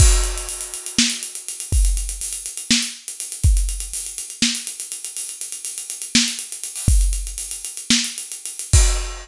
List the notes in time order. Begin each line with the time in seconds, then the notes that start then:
0.00 kick, crash
0.12 closed hi-hat
0.24 closed hi-hat
0.38 closed hi-hat
0.49 closed hi-hat
0.61 closed hi-hat
0.74 closed hi-hat
0.86 closed hi-hat
0.98 snare
1.10 closed hi-hat
1.23 closed hi-hat
1.35 closed hi-hat
1.48 closed hi-hat
1.60 closed hi-hat
1.72 kick, closed hi-hat
1.85 closed hi-hat
1.97 closed hi-hat
2.09 closed hi-hat
2.21 closed hi-hat
2.33 closed hi-hat
2.46 closed hi-hat
2.57 closed hi-hat
2.71 snare
2.82 closed hi-hat
3.08 closed hi-hat
3.20 closed hi-hat
3.32 closed hi-hat
3.44 kick, closed hi-hat
3.57 closed hi-hat
3.69 closed hi-hat
3.80 closed hi-hat
3.93 closed hi-hat
4.06 closed hi-hat
4.18 closed hi-hat
4.30 closed hi-hat
4.42 snare
4.55 closed hi-hat
4.67 closed hi-hat
4.80 closed hi-hat
4.92 closed hi-hat
5.05 closed hi-hat
5.17 closed hi-hat
5.29 closed hi-hat
5.41 closed hi-hat
5.52 closed hi-hat
5.65 closed hi-hat
5.78 closed hi-hat
5.90 closed hi-hat
6.02 closed hi-hat
6.15 snare
6.28 closed hi-hat
6.39 closed hi-hat
6.52 closed hi-hat
6.64 closed hi-hat
6.76 open hi-hat
6.88 kick, closed hi-hat
7.01 closed hi-hat
7.13 closed hi-hat
7.27 closed hi-hat
7.38 closed hi-hat
7.51 closed hi-hat
7.65 closed hi-hat
7.77 closed hi-hat
7.90 snare
8.04 closed hi-hat
8.18 closed hi-hat
8.32 closed hi-hat
8.46 closed hi-hat
8.59 closed hi-hat
8.73 kick, crash